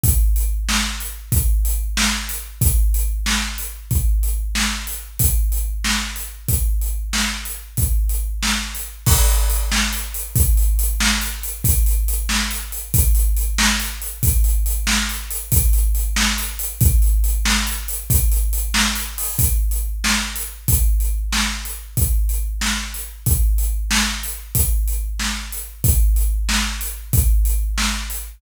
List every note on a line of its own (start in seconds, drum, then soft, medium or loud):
0.03 kick loud
0.03 closed hi-hat loud
0.36 closed hi-hat medium
0.69 snare loud
1.00 closed hi-hat medium
1.32 kick loud
1.32 closed hi-hat loud
1.65 closed hi-hat medium
1.97 snare loud
2.29 closed hi-hat medium
2.61 kick loud
2.61 closed hi-hat loud
2.94 closed hi-hat medium
3.26 snare loud
3.58 closed hi-hat medium
3.91 kick loud
3.91 closed hi-hat medium
4.23 closed hi-hat medium
4.55 snare loud
4.87 closed hi-hat medium
5.19 kick loud
5.19 closed hi-hat loud
5.52 closed hi-hat medium
5.84 snare loud
6.16 closed hi-hat medium
6.48 kick loud
6.48 closed hi-hat loud
6.81 closed hi-hat medium
7.13 snare loud
7.45 closed hi-hat medium
7.77 kick loud
7.77 closed hi-hat loud
8.09 closed hi-hat medium
8.43 snare loud
8.75 closed hi-hat medium
9.06 kick loud
9.06 crash loud
9.28 closed hi-hat medium
9.50 closed hi-hat medium
9.72 snare loud
9.93 closed hi-hat medium
10.14 closed hi-hat medium
10.36 kick loud
10.36 closed hi-hat loud
10.57 closed hi-hat medium
10.79 closed hi-hat loud
11.00 snare loud
11.21 closed hi-hat medium
11.43 closed hi-hat medium
11.64 kick loud
11.64 closed hi-hat loud
11.86 closed hi-hat medium
12.08 closed hi-hat medium
12.29 snare loud
12.51 closed hi-hat medium
12.72 closed hi-hat medium
12.94 kick loud
12.94 closed hi-hat loud
13.15 closed hi-hat medium
13.37 closed hi-hat medium
13.58 snare loud
13.80 closed hi-hat medium
14.02 closed hi-hat medium
14.23 kick loud
14.23 closed hi-hat loud
14.44 closed hi-hat medium
14.66 closed hi-hat medium
14.87 snare loud
15.09 closed hi-hat medium
15.31 closed hi-hat loud
15.52 kick loud
15.52 closed hi-hat loud
15.73 closed hi-hat medium
15.95 closed hi-hat medium
16.16 snare loud
16.38 closed hi-hat medium
16.59 closed hi-hat loud
16.81 kick loud
16.81 closed hi-hat loud
17.02 closed hi-hat medium
17.24 closed hi-hat medium
17.45 snare loud
17.67 closed hi-hat medium
17.88 closed hi-hat medium
18.10 kick loud
18.10 closed hi-hat loud
18.32 closed hi-hat medium
18.53 closed hi-hat medium
18.74 snare loud
18.96 closed hi-hat medium
19.18 open hi-hat medium
19.39 kick loud
19.39 closed hi-hat loud
19.71 closed hi-hat medium
20.04 snare loud
20.36 closed hi-hat medium
20.68 kick loud
20.68 closed hi-hat loud
21.00 closed hi-hat medium
21.32 snare loud
21.65 closed hi-hat medium
21.97 kick loud
21.97 closed hi-hat loud
22.29 closed hi-hat medium
22.61 snare loud
22.94 closed hi-hat medium
23.26 kick loud
23.26 closed hi-hat loud
23.58 closed hi-hat medium
23.91 snare loud
24.23 closed hi-hat medium
24.55 kick loud
24.55 closed hi-hat loud
24.88 closed hi-hat medium
25.19 snare loud
25.52 closed hi-hat medium
25.84 kick loud
25.84 closed hi-hat loud
26.16 closed hi-hat medium
26.49 snare loud
26.81 closed hi-hat medium
27.13 kick loud
27.13 closed hi-hat loud
27.45 closed hi-hat medium
27.78 snare loud
28.10 closed hi-hat medium